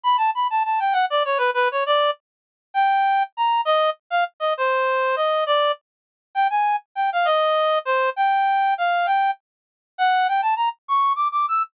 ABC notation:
X:1
M:6/8
L:1/8
Q:3/8=133
K:D
V:1 name="Clarinet"
b a b a a g | f d c B B c | d2 z4 | [K:Eb] g4 b2 |
e2 z f z e | c4 e2 | d2 z4 | g a2 z g f |
e4 c2 | g4 f2 | g2 z4 | [K:D] f2 g a _b z |
c'2 d' d' e' z |]